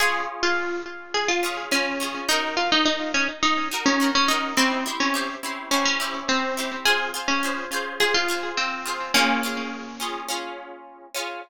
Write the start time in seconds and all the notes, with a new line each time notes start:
0.00 C#4 F4 G#4
0.43 F4
1.14 G#4
1.28 F4
1.43 C#4 F4 G#4
1.71 C#4 F4 G#4
2.00 C#4 F4 G#4
2.29 D#4 F#4 A#4
2.57 F4
2.72 D#4
2.85 D#4
3.14 C#4
3.43 D#4
3.71 D#4 F#4 A#4
3.86 C#4
4.00 D#4 F#4 A#4
4.15 C#4
4.28 D#4 F#4 A#4
4.57 C4 E4 G4 C5
4.86 E4 G4 C5
5.00 C#4
5.14 E4 G4 C5
5.43 E4 G4 C5
5.71 C#4 E4 G4 C5
5.85 C#4
6.00 E4 G4 C5
6.29 C4
6.57 E4 G4 C5
6.85 F4 G#4 C5
7.14 F4 G#4 C5
7.28 C#4
7.43 F4 G#4 C5
7.72 F4 G#4 C5
8.00 F4 G#4 C5
8.14 F4
8.28 F4 G#4 C5
8.57 C4
8.86 F4 G#4 C5
9.14 A#3 C#4 F4 G#4
9.43 C#4 F4 G#4
10.00 C#4 F4 G#4
10.28 C#4 F4 G#4
11.15 C#4 F4 G#4